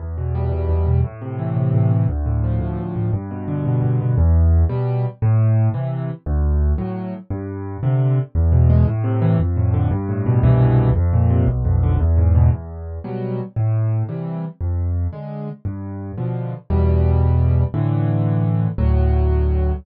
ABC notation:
X:1
M:6/8
L:1/8
Q:3/8=115
K:C
V:1 name="Acoustic Grand Piano" clef=bass
E,, B,, G, B,, E,, B,, | A,, C, E, C, A,, C, | D,, A,, F, A,, D,, A,, | G,, B,, D, B,, G,, B,, |
E,,3 [B,,G,]3 | A,,3 [C,E,]3 | D,,3 [A,,^F,]3 | G,,3 [C,D,]3 |
[K:Am] E,, B,, ^G, A,, C, E, | F,, A,, D, G,, A,, B,, | [C,,G,,B,,E,]3 F,, _B,, C, | B,,, F,, D, E,, ^G,, B,, |
[K:C] E,,3 [B,,^F,G,]3 | A,,3 [C,E,G,]3 | F,,3 [D,_A,]3 | G,,3 [B,,D,F,]3 |
[K:D] [E,,B,,G,]6 | [A,,D,E,]6 | [D,,A,,F,]6 |]